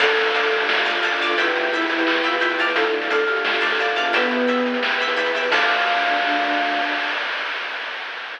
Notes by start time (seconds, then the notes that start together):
0.00 D2 D4 F4 A4 D5 F5 A5, kick, crash
0.09 D4 F4 A4, closed hi-hat
0.17 D2, closed hi-hat
0.21 closed hi-hat
0.26 closed hi-hat
0.30 D2, closed hi-hat
0.34 D5 F5 A5, closed hi-hat
0.43 closed hi-hat
0.51 D2 G4, closed hi-hat
0.60 D4 F4 A4, closed hi-hat
0.69 D2 F4, snare
0.77 closed hi-hat
0.85 D2 D5 F5 A5, closed hi-hat
0.95 D4 F4 A4, closed hi-hat
1.03 D2 F4 D5 F5 A5, closed hi-hat
1.12 closed hi-hat
1.20 D2 D5 F5 A5, closed hi-hat
1.29 D4 F4 A4, closed hi-hat
1.37 E2 E4 G4 B4 E5 G5 B5, kick, closed hi-hat
1.47 E4 G4 B4, closed hi-hat
1.55 E2, closed hi-hat
1.64 closed hi-hat
1.72 E2 E5 G5 B5, closed hi-hat
1.81 closed hi-hat
1.89 E2, closed hi-hat
1.98 E4 G4 B4, closed hi-hat
2.06 E2 E4, clap
2.15 closed hi-hat
2.24 E2 F4 E5 G5 B5, closed hi-hat
2.33 E4 G4 B4, closed hi-hat
2.40 E2 E4 E5 G5 B5, closed hi-hat
2.50 closed hi-hat
2.58 E2 E4 D5 F5 A5, closed hi-hat
2.67 E4 G4 B4, closed hi-hat
2.75 D2 D4 F4 A4, kick, closed hi-hat
2.85 D4 F4 A4, closed hi-hat
2.93 D2, closed hi-hat
3.02 closed hi-hat
3.10 D2 D5 F5 A5, closed hi-hat
3.19 closed hi-hat
3.28 D2 G4, closed hi-hat
3.36 D4 F4 A4, closed hi-hat
3.45 D2 F4, snare
3.54 closed hi-hat
3.61 D2 D5 F5 A5, closed hi-hat
3.66 closed hi-hat
3.71 D4 F4 A4, closed hi-hat
3.75 D2, closed hi-hat
3.79 F4 D5 F5 A5, closed hi-hat
3.88 closed hi-hat
3.96 E2 D5 F5 A5, closed hi-hat
4.04 D4 F4 A4, closed hi-hat
4.13 B3 E4 G4 B4 E5 G5 B5, kick, closed hi-hat
4.22 E4 G4 B4, closed hi-hat
4.31 E2, closed hi-hat
4.40 closed hi-hat
4.47 E2 E5 G5 B5, closed hi-hat
4.57 closed hi-hat
4.66 E2, closed hi-hat
4.74 E4 G4 B4, closed hi-hat
4.83 E2, snare
4.91 closed hi-hat
5.00 E2 E5 G5 B5, closed hi-hat
5.08 E4 G4 B4, closed hi-hat
5.17 E2 E5 G5 B5, closed hi-hat
5.26 closed hi-hat
5.34 E2 E5 G5 B5, closed hi-hat
5.42 E4 G4 B4, closed hi-hat
5.52 D2 D4 F4 A4 D5 F5 A5, kick, crash